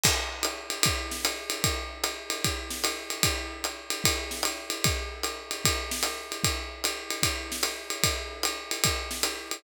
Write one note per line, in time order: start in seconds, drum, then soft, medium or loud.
0.04 kick medium
0.04 crash loud
0.04 ride loud
0.43 hi-hat pedal medium
0.43 ride medium
0.70 ride medium
0.83 kick medium
0.83 ride loud
1.11 snare medium
1.25 hi-hat pedal medium
1.25 ride medium
1.50 ride medium
1.64 kick medium
1.64 ride loud
2.04 hi-hat pedal medium
2.04 ride medium
2.30 ride medium
2.44 kick medium
2.44 ride medium
2.70 snare medium
2.84 hi-hat pedal medium
2.84 ride medium
3.10 ride medium
3.23 kick medium
3.23 ride loud
3.64 hi-hat pedal medium
3.64 ride medium
3.90 ride medium
4.04 kick medium
4.04 ride loud
4.31 snare medium
4.43 hi-hat pedal medium
4.43 ride medium
4.70 ride medium
4.84 kick medium
4.84 ride loud
5.23 hi-hat pedal medium
5.23 ride medium
5.51 ride medium
5.65 kick medium
5.65 ride loud
5.91 snare medium
6.03 hi-hat pedal medium
6.03 ride medium
6.32 ride medium
6.44 kick medium
6.44 ride loud
6.84 hi-hat pedal medium
6.84 ride medium
7.11 ride medium
7.23 kick medium
7.23 ride loud
7.52 snare medium
7.63 hi-hat pedal medium
7.63 ride medium
7.90 ride medium
8.03 kick medium
8.03 ride loud
8.43 hi-hat pedal medium
8.43 ride medium
8.71 ride medium
8.84 kick medium
8.84 ride loud
9.11 snare medium
9.23 hi-hat pedal medium
9.23 ride medium
9.51 ride medium